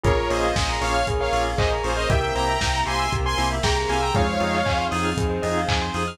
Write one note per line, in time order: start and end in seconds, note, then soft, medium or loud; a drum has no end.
0.03 0.26 A#1 medium
0.03 0.13 A#3 medium
0.03 1.06 A#3 medium
0.03 0.13 C#4 medium
0.03 1.06 C#4 medium
0.03 0.53 F4 medium
0.03 0.13 F4 medium
0.03 1.07 F4 medium
0.03 0.15 G#4 medium
0.03 0.13 G#4 medium
0.03 1.06 G#4 medium
0.03 0.29 A#4 medium
0.03 0.29 C#5 medium
0.03 kick medium
0.03 closed hi-hat medium
0.17 0.28 A#4 medium
0.29 0.52 A#1 medium
0.29 0.49 A#3 medium
0.29 0.49 C#4 medium
0.29 0.49 F4 medium
0.29 0.49 G#4 medium
0.29 0.75 C5 soft
0.29 0.41 C#5 medium
0.29 0.75 D#5 medium
0.29 open hi-hat medium
0.44 0.56 F5 medium
0.56 0.78 A#1 medium
0.56 0.67 G#5 medium
0.56 kick medium
0.56 snare medium
0.69 0.81 A#5 medium
0.81 1.03 A#1 medium
0.81 1.00 A#3 medium
0.81 1.00 C#4 medium
0.81 1.00 F4 medium
0.81 1.00 G#4 medium
0.81 1.06 C#5 medium
0.81 1.06 F5 medium
0.81 0.94 C#6 medium
0.81 open hi-hat medium
0.94 1.06 F6 medium
1.06 1.29 A#1 medium
1.06 2.08 A#3 medium
1.06 2.08 C#4 medium
1.06 2.08 G#4 medium
1.06 1.19 G#4 medium
1.06 2.08 A#4 medium
1.06 kick medium
1.06 closed hi-hat medium
1.20 1.32 A#4 medium
1.20 1.43 C#5 medium
1.20 1.43 F5 medium
1.32 1.54 A#1 medium
1.32 1.51 A#3 medium
1.32 1.51 C#4 medium
1.32 1.51 F4 medium
1.32 1.51 G#4 medium
1.32 1.44 C#5 medium
1.32 open hi-hat medium
1.46 1.57 F5 medium
1.58 1.80 A#1 medium
1.58 2.07 G#4 medium
1.58 1.71 C5 medium
1.58 1.71 D#5 medium
1.58 1.71 G#5 medium
1.58 kick medium
1.58 clap medium
1.71 1.82 A#5 medium
1.83 2.06 A#1 medium
1.83 1.93 A#3 medium
1.83 1.93 C#4 medium
1.83 1.93 F4 medium
1.83 1.93 G#4 medium
1.83 1.97 G#4 soft
1.83 1.96 C5 medium
1.83 1.95 C#6 medium
1.83 open hi-hat medium
1.96 2.09 C5 medium
1.96 2.09 D#5 medium
1.96 2.07 F6 medium
2.10 2.32 C2 medium
2.10 2.19 A#3 medium
2.10 3.11 A#3 medium
2.10 2.19 C4 medium
2.10 3.11 C4 medium
2.10 2.19 E4 medium
2.10 3.11 E4 medium
2.10 2.21 G4 medium
2.10 2.19 G4 medium
2.10 3.11 G4 medium
2.10 2.58 A#4 medium
2.10 2.34 E5 medium
2.10 2.34 G5 medium
2.10 kick medium
2.10 closed hi-hat medium
2.21 2.32 A#4 medium
2.35 2.57 C2 medium
2.35 2.53 A#3 medium
2.35 2.53 C4 medium
2.35 2.53 E4 medium
2.35 2.53 G4 medium
2.35 2.47 C5 medium
2.35 2.81 G5 medium
2.35 2.81 A#5 medium
2.35 open hi-hat medium
2.48 2.60 E5 medium
2.61 2.83 C2 medium
2.61 2.72 G5 medium
2.61 kick medium
2.61 snare medium
2.74 2.86 A#5 medium
2.86 3.08 C2 medium
2.86 3.05 A#3 medium
2.86 3.05 C4 medium
2.86 3.05 E4 medium
2.86 3.05 G4 medium
2.86 3.12 G#5 medium
2.86 2.98 C6 medium
2.86 3.12 C6 medium
2.86 open hi-hat medium
2.99 3.11 E6 medium
3.12 3.34 C2 medium
3.12 4.14 A#3 medium
3.12 4.14 C4 medium
3.12 4.14 G4 medium
3.12 3.24 G4 medium
3.12 4.14 A#4 medium
3.12 kick medium
3.12 closed hi-hat medium
3.24 3.36 A#4 medium
3.24 3.48 G#5 medium
3.24 3.48 C6 medium
3.38 3.60 C2 medium
3.38 3.56 A#3 medium
3.38 3.56 C4 medium
3.38 3.56 E4 medium
3.38 3.56 G4 medium
3.38 3.49 C5 medium
3.38 open hi-hat medium
3.51 3.62 E5 medium
3.63 3.85 C2 medium
3.63 4.11 G#4 medium
3.63 3.75 G5 medium
3.63 3.76 G5 medium
3.63 3.76 A#5 medium
3.63 kick medium
3.63 snare medium
3.76 3.88 A#5 medium
3.88 4.11 C2 medium
3.88 3.98 A#3 medium
3.88 3.98 C4 medium
3.88 3.98 E4 medium
3.88 3.98 G4 medium
3.88 4.01 F5 soft
3.88 4.01 G#5 medium
3.88 3.99 C6 medium
3.88 open hi-hat medium
4.00 4.14 G5 medium
4.00 4.14 A#5 medium
4.00 4.12 E6 medium
4.14 4.37 F2 medium
4.14 4.63 G#3 medium
4.14 5.16 C4 medium
4.14 4.24 C4 medium
4.14 5.16 D#4 medium
4.14 4.24 D#4 medium
4.14 5.16 F4 medium
4.14 4.24 F4 medium
4.14 4.26 G#4 medium
4.14 5.16 G#4 medium
4.14 4.24 G#4 medium
4.14 4.85 C#5 medium
4.14 4.85 F5 medium
4.14 kick medium
4.14 closed hi-hat medium
4.29 4.40 C5 medium
4.40 4.63 F2 medium
4.40 4.58 C4 medium
4.40 4.58 D#4 medium
4.40 4.58 F4 medium
4.40 4.58 G#4 medium
4.40 4.53 D#5 medium
4.40 open hi-hat medium
4.54 4.65 F5 medium
4.66 4.88 F2 medium
4.66 5.40 C4 medium
4.66 4.77 G#5 medium
4.66 kick medium
4.66 clap medium
4.78 4.89 C6 medium
4.91 5.14 F2 medium
4.91 5.10 C4 medium
4.91 5.10 D#4 medium
4.91 5.10 F4 medium
4.91 5.10 G#4 medium
4.91 5.03 D#6 medium
4.91 open hi-hat medium
5.05 5.16 F6 medium
5.17 5.39 F2 medium
5.17 6.18 C4 medium
5.17 6.18 D#4 medium
5.17 6.18 G#4 medium
5.17 5.29 G#4 medium
5.17 6.18 C5 medium
5.17 kick medium
5.17 closed hi-hat medium
5.30 5.42 C5 medium
5.42 5.65 F2 medium
5.42 5.61 C4 medium
5.42 5.61 D#4 medium
5.42 5.61 F4 medium
5.42 5.61 G#4 medium
5.42 5.54 D#5 medium
5.42 open hi-hat medium
5.57 5.69 F5 medium
5.68 5.91 F2 medium
5.68 5.80 G#5 medium
5.68 kick medium
5.68 clap loud
5.82 5.93 C6 medium
5.94 6.16 F2 medium
5.94 6.03 C4 medium
5.94 6.03 D#4 medium
5.94 6.03 F4 medium
5.94 6.03 G#4 medium
5.94 6.07 D#6 medium
5.94 open hi-hat medium
6.07 6.18 F6 medium